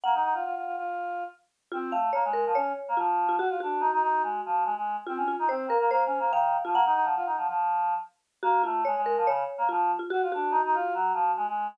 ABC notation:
X:1
M:4/4
L:1/16
Q:1/4=143
K:Bbm
V:1 name="Marimba"
g8 z8 | F2 f2 d2 B2 d4 F3 F | G2 G12 z2 | F2 F2 c2 B2 c4 f3 F |
g8 z8 | G2 F2 d2 B2 d4 F3 F | G2 G12 z2 |]
V:2 name="Choir Aahs"
B, E E F F F F F5 z4 | C2 =A,2 B, _A,2 F, D2 z B, F,4 | G F =D2 E E E2 A,2 F,2 A, A,2 z | C D2 E C2 B, B, (3B,2 D2 B,2 E,3 F, |
B, E E F, F E F, F,5 z4 | B,2 =A,2 _A, A,2 F, D,2 z B, F,2 z2 | G F =D2 E E F2 G,2 F,2 A, A,2 z |]